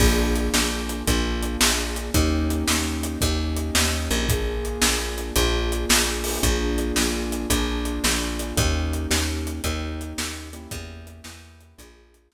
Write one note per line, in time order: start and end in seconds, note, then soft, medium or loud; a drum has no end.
0.00 0.49 A#1 loud
0.00 1.05 A#3 medium
0.00 1.05 D4 medium
0.00 1.05 F4 medium
0.00 1.05 G#4 medium
0.00 kick loud
0.00 crash medium
0.36 closed hi-hat medium
0.54 1.03 A#1 medium
0.54 snare medium
0.89 closed hi-hat medium
1.07 1.57 A#1 medium
1.07 2.12 A#3 medium
1.07 2.12 D4 medium
1.07 2.12 F4 medium
1.07 2.12 G#4 medium
1.07 kick medium
1.07 closed hi-hat medium
1.43 closed hi-hat medium
1.61 2.10 A#1 medium
1.61 snare loud
1.96 closed hi-hat medium
2.14 2.64 D#2 medium
2.14 3.19 A#3 medium
2.14 3.19 C#4 medium
2.14 3.19 D#4 medium
2.14 3.19 G4 medium
2.14 kick medium
2.14 closed hi-hat medium
2.50 closed hi-hat medium
2.68 3.17 D#2 medium
2.68 snare medium
3.03 closed hi-hat medium
3.21 3.71 D#2 medium
3.21 4.27 A#3 medium
3.21 4.27 C#4 medium
3.21 4.27 D#4 medium
3.21 4.27 G4 medium
3.21 kick medium
3.21 closed hi-hat medium
3.57 closed hi-hat medium
3.75 4.09 D#2 medium
3.75 snare loud
4.11 4.78 A#1 medium
4.11 closed hi-hat medium
4.29 5.34 A#3 medium
4.29 5.34 D4 medium
4.29 5.34 F4 medium
4.29 5.34 G#4 medium
4.29 kick loud
4.29 closed hi-hat medium
4.65 closed hi-hat medium
4.82 5.31 A#1 medium
4.82 snare loud
5.18 closed hi-hat medium
5.36 5.85 A#1 loud
5.36 6.41 A#3 medium
5.36 6.41 D4 medium
5.36 6.41 F4 medium
5.36 6.41 G#4 medium
5.36 kick medium
5.36 closed hi-hat medium
5.72 closed hi-hat medium
5.89 6.39 A#1 medium
5.89 snare loud
6.24 open hi-hat medium
6.43 6.92 A#1 medium
6.43 7.48 A#3 medium
6.43 7.48 D4 medium
6.43 7.48 F4 medium
6.43 7.48 G#4 medium
6.43 kick medium
6.43 closed hi-hat medium
6.78 closed hi-hat medium
6.96 7.46 A#1 medium
6.96 snare medium
7.32 closed hi-hat medium
7.50 7.99 A#1 medium
7.50 8.55 A#3 medium
7.50 8.55 D4 medium
7.50 8.55 F4 medium
7.50 8.55 G#4 medium
7.50 kick medium
7.50 closed hi-hat loud
7.85 closed hi-hat medium
8.04 8.53 A#1 medium
8.04 snare medium
8.39 closed hi-hat medium
8.56 9.07 D#2 loud
8.56 9.61 A#3 medium
8.56 9.61 C#4 medium
8.56 9.61 D#4 medium
8.56 9.61 G4 medium
8.56 kick loud
8.56 closed hi-hat medium
8.93 closed hi-hat medium
9.11 9.60 D#2 medium
9.11 snare loud
9.47 closed hi-hat medium
9.64 10.13 D#2 medium
9.64 10.49 A#3 medium
9.64 10.49 C#4 medium
9.64 10.49 D#4 medium
9.64 10.49 G4 medium
9.64 kick medium
9.64 closed hi-hat medium
10.01 closed hi-hat medium
10.18 10.67 D#2 medium
10.18 snare loud
10.53 11.76 A#3 medium
10.53 11.76 C#4 medium
10.53 11.76 E4 medium
10.53 11.76 G4 medium
10.53 closed hi-hat medium
10.71 11.21 E2 loud
10.71 kick loud
10.71 closed hi-hat loud
11.07 closed hi-hat medium
11.24 11.74 E2 medium
11.24 snare medium
11.61 closed hi-hat medium
11.78 12.28 A#1 loud
11.78 12.34 A#3 medium
11.78 12.34 D4 medium
11.78 12.34 F4 medium
11.78 12.34 G#4 medium
11.78 kick medium
11.78 closed hi-hat loud
12.14 closed hi-hat medium
12.32 12.34 A#1 medium
12.32 snare medium